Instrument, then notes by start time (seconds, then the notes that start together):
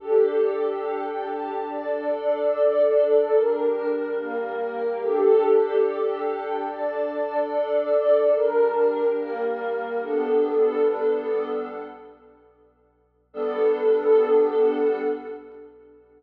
pad 2 (warm)
0.00 D4 G4 A4
1.67 D4 A4 D5
3.33 G3 D4 A#4
4.17 G3 A#3 A#4
5.00 D4 G4 A4
6.67 D4 A4 D5
8.33 G3 D4 A#4
9.17 G3 A#3 A#4
10.00 G3 B3 D4 A4
13.33 G3 B3 D4 A4